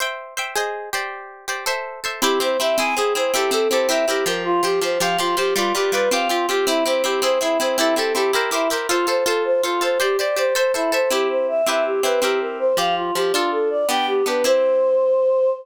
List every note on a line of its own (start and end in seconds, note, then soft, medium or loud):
0.00 0.34 C5 medium
0.00 0.34 E5 medium
0.00 0.34 G5 medium
0.37 0.54 C5 medium
0.37 0.54 E5 medium
0.37 0.54 G5 medium
0.55 0.90 G#4 medium
0.55 0.90 C5 medium
0.55 0.90 D#5 medium
0.93 1.46 G4 medium
0.93 1.46 C5 medium
0.93 1.46 D5 medium
1.48 1.65 G4 medium
1.48 1.65 C5 medium
1.48 1.65 D5 medium
1.66 2.00 A4 medium
1.66 2.00 C5 medium
1.66 2.00 E5 medium
2.04 2.21 A4 medium
2.04 2.21 C5 medium
2.04 2.21 E5 medium
2.22 2.39 C4 loud
2.22 2.39 E4 loud
2.22 2.39 G4 medium
2.22 2.39 G4 loud
2.40 2.57 C4 loud
2.40 2.57 E4 medium
2.40 2.57 G4 medium
2.40 2.58 C5 medium
2.59 2.77 C4 loud
2.59 2.77 E4 loud
2.59 2.77 G4 medium
2.59 2.76 E5 medium
2.78 2.95 C4 loud
2.78 2.95 E4 loud
2.78 2.95 G#4 loud
2.78 2.95 G#5 medium
2.96 3.14 C4 medium
2.96 3.14 E4 loud
2.96 3.13 G#4 medium
2.96 3.14 G#4 loud
3.15 3.32 C4 loud
3.15 3.32 E4 medium
3.15 3.32 G#4 loud
3.15 3.32 C5 medium
3.33 3.51 C4 loud
3.33 3.51 E4 loud
3.33 3.50 G4 medium
3.33 3.51 G4 loud
3.33 3.51 A4 loud
3.51 3.68 C4 loud
3.51 3.68 E4 loud
3.51 3.68 G4 medium
3.51 3.69 A4 medium
3.51 3.68 A4 medium
3.70 3.88 C4 loud
3.70 3.88 E4 medium
3.70 3.88 G4 loud
3.70 3.88 A4 medium
3.70 3.87 C5 medium
3.89 4.06 C4 loud
3.89 4.06 E4 loud
3.89 4.06 G4 loud
3.89 4.06 A#4 loud
3.89 4.06 E5 medium
4.07 4.25 C4 medium
4.07 4.25 E4 loud
4.07 4.24 G4 medium
4.07 4.25 G4 loud
4.07 4.25 A#4 loud
4.26 4.61 F3 loud
4.26 4.61 G4 loud
4.26 4.43 A#4 medium
4.26 4.61 C5 loud
4.45 4.62 F4 medium
4.63 4.80 F3 medium
4.63 4.80 G4 medium
4.63 4.80 G4 loud
4.63 4.80 C5 loud
4.81 4.98 F3 medium
4.81 4.98 G4 medium
4.81 4.99 C5 medium
4.81 4.98 C5 loud
5.00 5.17 F3 loud
5.00 5.17 G4 loud
5.00 5.17 C5 loud
5.00 5.17 F5 medium
5.18 5.35 F3 medium
5.18 5.35 F4 medium
5.18 5.35 G4 loud
5.18 5.35 C5 loud
5.37 5.54 F3 loud
5.37 5.54 G4 medium
5.37 5.54 C5 loud
5.56 5.73 G3 loud
5.56 5.73 F4 medium
5.56 5.73 F4 loud
5.56 5.73 B4 loud
5.56 5.73 D5 loud
5.74 5.92 G3 loud
5.74 5.92 F4 medium
5.74 5.91 G4 medium
5.74 5.92 B4 medium
5.74 5.92 D5 medium
5.92 6.09 G3 medium
5.92 6.09 F4 medium
5.92 6.09 B4 medium
5.92 6.09 B4 loud
5.92 6.09 D5 medium
6.11 6.28 C4 loud
6.11 6.28 F4 loud
6.11 6.28 G4 loud
6.11 6.28 F5 medium
6.29 6.46 C4 medium
6.29 6.47 F4 medium
6.29 6.46 F4 loud
6.29 6.46 G4 medium
6.48 6.66 C4 medium
6.48 6.66 F4 medium
6.48 6.65 G4 medium
6.48 6.66 G4 medium
6.67 6.84 C4 loud
6.67 6.84 E4 medium
6.67 6.84 E4 loud
6.67 6.84 G4 loud
6.85 7.03 C4 loud
6.85 7.03 E4 loud
6.85 7.03 G4 medium
6.85 7.02 C5 medium
7.04 7.21 C4 loud
7.04 7.21 E4 loud
7.04 7.21 G4 medium
7.04 7.21 G4 loud
7.22 7.39 C4 loud
7.22 7.39 E4 loud
7.22 7.39 G#4 loud
7.22 7.39 C5 medium
7.41 7.58 C4 medium
7.41 7.58 E4 medium
7.41 7.58 G#4 loud
7.59 7.77 C4 loud
7.59 7.77 E4 loud
7.59 7.77 G#4 medium
7.59 7.76 C5 medium
7.78 7.95 C4 loud
7.78 7.95 E4 medium
7.78 7.95 E4 loud
7.78 7.95 G4 loud
7.78 7.95 A4 loud
7.96 8.13 C4 medium
7.96 8.13 E4 medium
7.96 8.13 G4 loud
7.96 8.13 A4 medium
7.96 8.13 A4 loud
8.15 8.32 C4 medium
8.15 8.32 E4 loud
8.15 8.32 G4 medium
8.15 8.32 A4 medium
8.33 8.50 E4 loud
8.33 8.50 G4 loud
8.33 8.50 A#4 medium
8.33 8.50 A#4 loud
8.33 8.50 C5 loud
8.51 8.68 E4 loud
8.51 8.69 E4 medium
8.51 8.68 G4 loud
8.51 8.68 A#4 loud
8.51 8.68 C5 loud
8.70 8.87 E4 medium
8.70 8.87 G4 loud
8.70 8.87 A#4 medium
8.70 8.87 C5 loud
8.89 9.06 F4 medium
8.89 9.06 F4 loud
8.89 9.06 A4 loud
8.89 9.06 C5 loud
9.07 9.24 F4 medium
9.07 9.24 A4 loud
9.07 9.24 C5 medium
9.07 9.24 C5 loud
9.26 9.61 F4 loud
9.26 9.43 A4 medium
9.26 9.61 A4 loud
9.26 9.61 C5 loud
9.45 9.62 C5 medium
9.63 9.80 F4 medium
9.63 9.80 F4 loud
9.63 9.80 A4 medium
9.63 9.80 C5 loud
9.81 9.98 F4 medium
9.81 9.98 A4 medium
9.81 9.99 C5 medium
9.81 9.98 C5 medium
10.00 10.17 G4 loud
10.00 10.17 G4 medium
10.00 10.17 C5 loud
10.00 10.17 D5 loud
10.18 10.36 G4 medium
10.18 10.36 C5 medium
10.18 10.35 D5 medium
10.18 10.36 D5 loud
10.36 10.54 G4 loud
10.36 10.54 C5 medium
10.36 10.54 D5 loud
10.55 10.72 A4 loud
10.55 10.73 C5 medium
10.55 10.72 C5 loud
10.55 10.72 E5 loud
10.74 10.91 E4 medium
10.74 10.91 A4 medium
10.74 10.91 C5 loud
10.74 10.91 E5 loud
10.92 11.09 A4 loud
10.92 11.10 C5 medium
10.92 11.09 C5 medium
10.92 11.09 E5 loud
11.10 11.62 C4 loud
11.10 11.62 E4 loud
11.10 11.28 G4 medium
11.10 11.62 G4 loud
11.30 11.47 C5 medium
11.48 11.65 E5 medium
11.66 12.01 C4 medium
11.66 12.01 E4 loud
11.66 12.01 G4 loud
11.66 12.01 B4 loud
11.66 11.84 E5 medium
11.85 12.02 G4 medium
12.03 12.20 C4 medium
12.03 12.20 E4 medium
12.03 12.20 G4 medium
12.03 12.21 B4 medium
12.03 12.20 B4 medium
12.22 12.73 C4 loud
12.22 12.73 E4 loud
12.22 12.39 G4 medium
12.22 12.73 G4 loud
12.22 12.73 A#4 loud
12.41 12.58 A#4 medium
12.59 12.76 C5 medium
12.77 13.11 F3 medium
12.77 13.11 G4 loud
12.77 13.11 C5 loud
12.77 12.95 F5 medium
12.96 13.13 F4 medium
13.15 13.32 F3 medium
13.15 13.32 G4 medium
13.15 13.32 C5 medium
13.33 13.85 D4 loud
13.33 13.50 F4 medium
13.33 13.85 F4 loud
13.33 13.85 A4 loud
13.52 13.69 A4 medium
13.70 13.87 D5 medium
13.89 14.23 B3 loud
13.89 14.23 D4 loud
13.89 14.23 G4 loud
13.89 14.06 G5 medium
14.07 14.24 G4 medium
14.26 14.43 B3 medium
14.26 14.43 D4 medium
14.26 14.43 G4 medium
14.26 14.43 B4 medium
14.44 15.50 C4 loud
14.44 15.50 E4 loud
14.44 15.50 G4 loud
14.44 15.50 C5 loud